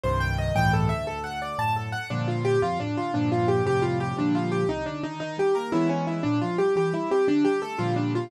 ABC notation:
X:1
M:6/8
L:1/8
Q:3/8=116
K:Gm
V:1 name="Acoustic Grand Piano"
c g e g A =e | A ^f d a A f | D F G F D F | D F G G F G |
D F G E D E | E G B =E ^C E | D F G G =E G | D G A F D F |]
V:2 name="Acoustic Grand Piano"
[C,,G,,E,]3 [^C,,G,,A,,=E,]2 D,,- | D,,3 [^F,,A,,]3 | [G,,B,,D,F,]3 F,, A,, D, | [G,,B,,D,F,]3 [F,,A,,C,G,]3 |
[B,,D,F,G,]3 C,, D, E, | E, G, B, [=E,^G,=B,^C]3 | B,, F, G, =E, G, C | D, G, A, [B,,D,F,G,]3 |]